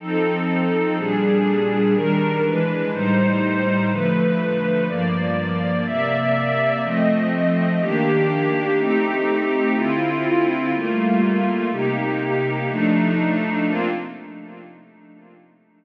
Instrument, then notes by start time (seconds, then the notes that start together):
pad 2 (warm)
0.00 F3 C4 D#4 A4
0.98 A#2 G3 D4 G#4
1.95 D#3 G3 D4 A#4
2.44 E3 G#3 D4 B4
2.92 A2 G3 D#4 C5
3.90 D3 F3 A3 B4
4.88 G2 F3 A#3 D5
5.86 C3 A#3 D5 E5
6.83 F3 A3 C4 D#5
7.81 D#3 A#3 D4 G4
8.78 A3 C4 D#4 G4
9.75 D3 C4 E4 F4
10.73 G3 A3 A#3 F4
11.71 C3 A#3 D#4 G4
12.68 F3 A3 D4 D#4
13.66 A#3 C4 D4 F4